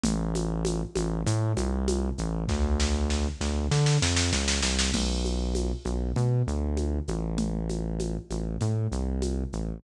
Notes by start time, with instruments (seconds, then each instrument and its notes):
0.03 synth bass 1 A1, low conga, shaker
0.35 high conga, shaker
0.65 high conga, shaker
0.95 synth bass 1 A1, high conga, shaker
1.26 synth bass 1 A2, low conga, shaker
1.57 synth bass 1 C2, high conga, shaker
1.88 high conga, shaker
2.18 synth bass 1 A1, shaker
2.48 synth bass 1 D2, kick, snare
2.80 snare
3.10 snare
3.41 synth bass 1 D2, snare
3.71 synth bass 1 D3, snare
3.86 snare
4.02 synth bass 1 F2, snare
4.16 snare
4.33 synth bass 1 C#2, snare
4.48 snare
4.63 synth bass 1 C2, snare
4.79 snare
4.93 synth bass 1 B1, crash, low conga, shaker
5.25 high conga, shaker
5.55 high conga, shaker
5.85 synth bass 1 B1, high conga, shaker
6.16 synth bass 1 B2, low conga, shaker
6.47 synth bass 1 D2, shaker
6.77 high conga, shaker
7.08 synth bass 1 A1, high conga, shaker
7.38 low conga, shaker
7.69 high conga, shaker
7.99 high conga, shaker
8.30 synth bass 1 A1, high conga, shaker
8.61 synth bass 1 A2, low conga, shaker
8.92 synth bass 1 C2, shaker
9.22 high conga, shaker
9.53 synth bass 1 A1, shaker